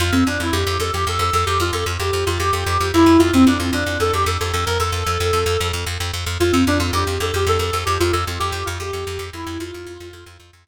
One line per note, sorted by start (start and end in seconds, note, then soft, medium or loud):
0.00 0.11 F2 loud
0.00 0.13 F4 loud
0.12 0.24 F2 medium
0.12 0.25 C4 medium
0.27 0.38 F2 medium
0.27 0.39 D4 medium
0.40 0.51 F2 medium
0.40 0.53 E4 medium
0.52 0.64 F2 loud
0.52 0.76 G4 medium
0.67 0.78 F2 medium
0.80 0.91 F2 medium
0.80 0.92 A4 loud
0.93 1.05 F2 medium
0.93 1.04 G4 medium
1.07 1.18 F2 medium
1.07 1.20 A4 loud
1.19 1.30 F2 medium
1.19 1.33 A4 loud
1.33 1.45 F2 loud
1.33 1.46 A4 loud
1.46 1.58 F2 medium
1.46 1.59 G4 loud
1.60 1.71 F2 medium
1.60 1.72 F4 loud
1.73 1.84 F2 medium
1.73 1.85 A4 loud
1.86 1.98 F2 medium
2.00 2.11 F2 medium
2.00 2.25 G4 medium
2.13 2.24 F2 medium
2.26 2.38 F2 medium
2.26 2.38 F4 loud
2.40 2.51 F2 medium
2.40 2.88 G4 loud
2.53 2.64 F2 medium
2.66 2.78 F2 medium
2.80 2.92 F2 medium
2.94 3.05 F2 medium
2.94 3.19 E4 loud
3.06 3.18 F2 medium
3.18 3.31 F2 medium
3.18 3.31 F4 loud
3.33 3.45 F2 medium
3.33 3.46 C4 loud
3.47 3.58 F2 medium
3.47 3.59 D4 medium
3.58 3.71 F2 medium
3.58 3.70 F4 medium
3.73 3.84 F2 medium
3.73 3.97 D4 medium
3.86 3.98 F2 medium
4.00 4.11 F2 medium
4.00 4.12 A4 loud
4.13 4.25 F2 medium
4.13 4.25 G4 loud
4.26 4.38 F2 loud
4.26 4.40 A4 medium
4.40 4.52 F2 medium
4.40 4.52 A4 loud
4.53 4.65 F2 medium
4.53 4.64 A4 loud
4.66 4.78 F2 medium
4.66 4.78 A#4 medium
4.80 4.91 F2 medium
4.80 5.68 A4 loud
4.92 5.04 F2 medium
5.06 5.18 F2 medium
5.20 5.32 F2 medium
5.33 5.44 F2 medium
5.46 5.57 F2 loud
5.61 5.72 F2 medium
5.73 5.85 F2 medium
5.86 5.98 F2 medium
6.00 6.12 F2 medium
6.13 6.25 F2 medium
6.26 6.38 F2 medium
6.40 6.52 F2 medium
6.40 6.52 F4 loud
6.52 6.65 F2 medium
6.52 6.63 C4 medium
6.67 6.78 F2 medium
6.67 6.78 D4 medium
6.79 6.91 F2 medium
6.79 6.92 F4 medium
6.93 7.04 F2 loud
6.93 7.15 G4 medium
7.07 7.18 F2 medium
7.20 7.32 F2 medium
7.20 7.34 A4 medium
7.34 7.45 F2 medium
7.34 7.47 G4 loud
7.47 7.58 F2 medium
7.47 7.60 A4 loud
7.59 7.71 F2 medium
7.59 7.72 A4 medium
7.72 7.85 F2 medium
7.72 7.83 A4 loud
7.85 7.98 F2 medium
7.85 7.96 G4 medium
8.00 8.12 F2 loud
8.00 8.11 F4 loud
8.12 8.25 F2 medium
8.12 8.24 A4 medium
8.27 8.39 F2 medium
8.39 8.52 F2 medium
8.39 8.65 G4 loud
8.52 8.64 F2 medium
8.65 8.79 F2 loud
8.65 8.77 F4 medium
8.80 8.91 F2 medium
8.80 9.25 G4 medium
8.93 9.05 F2 medium
9.07 9.18 F2 loud
9.19 9.30 F2 medium
9.33 9.45 F2 medium
9.33 9.59 E4 medium
9.47 9.58 F2 loud
9.60 9.71 F2 loud
9.60 10.35 F4 loud
9.74 9.86 F2 medium
9.87 9.98 F2 medium
10.00 10.12 F2 medium
10.13 10.24 F2 medium
10.26 10.38 F2 loud
10.40 10.51 F2 medium
10.53 10.65 F2 medium
10.67 10.68 F2 medium